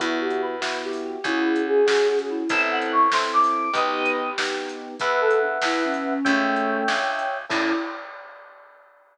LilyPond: <<
  \new Staff \with { instrumentName = "Choir Aahs" } { \time 6/8 \key e \dorian \tempo 4. = 96 e'8 g'8 b'4 g'8 g'8 | <e' gis'>4 gis'8 gis'8 gis'16 gis'16 e'8 | e''8 fis''8 des'''8 c'''8 d'''4 | <b' dis''>4 g'4 r4 |
b'8 a'8 d'8 e'8 cis'4 | <a cis'>4. d'4 r8 | e'4. r4. | }
  \new Staff \with { instrumentName = "Electric Piano 1" } { \time 6/8 \key e \dorian <b e' fis'>4. <b e' fis'>4. | <cis' fis' gis'>4. <cis' fis' gis'>4. | <c' e' a'>4. <c' e' a'>4. | <b dis' g'>4. <b dis' g'>4. |
<b' e'' fis''>2. | <cis'' e'' g''>2. | <cis' e' a'>4. r4. | }
  \new Staff \with { instrumentName = "Electric Bass (finger)" } { \clef bass \time 6/8 \key e \dorian e,2. | cis,2. | a,,2. | b,,2. |
e,4. e,4. | cis,4. cis,4. | a,4. r4. | }
  \new DrumStaff \with { instrumentName = "Drums" } \drummode { \time 6/8 <hh bd>8. hh8. sn8. hho8. | <hh bd>8. hh8. sn8. hh8. | <hh bd>8. hh8. sn8. hho8. | <hh bd>8. hh8. sn8. hh8. |
<hh bd>8. hh8. sn8. hh8. | <hh bd>8. hh8. sn8. hh8. | <cymc bd>4. r4. | }
>>